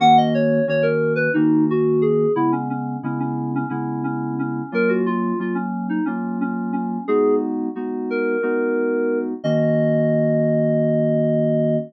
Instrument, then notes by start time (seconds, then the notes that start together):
electric piano 2
0.00 D#3 A#3 C#4 F#4 F#5
0.17 D#5
0.34 C#5
0.67 D#3 A#3 C#4 F#4 C#5
0.82 A#4
1.16 B4
1.34 D#3 A#3 C#4 D#4 F#4
1.70 F#4
2.02 G#4
2.36 C#3 G#3 B3 E4
2.52 C#4
2.70 C#4
3.03 C#3 G#3 B3 C#4 E4
3.20 C#4
3.55 C#4
3.69 C#3 G#3 B3 C#4 E4
4.04 C#4
4.39 C#4
4.72 F#3 A#3 C#4 F4 A#4
4.89 F#4
5.06 F4
5.39 F#3 A#3 C#4 F4
5.55 C#4
5.89 D#4
6.05 F#3 A#3 C#4 F4
6.41 C#4
6.73 C#4
7.08 G#3 B3 D#4 F#4 G#4
7.75 G#3 B3 D#4 F#4
8.10 A#4
8.43 G#3 B3 D#4 F#4
9.44 D#3 A#3 C#4 F#4 D#5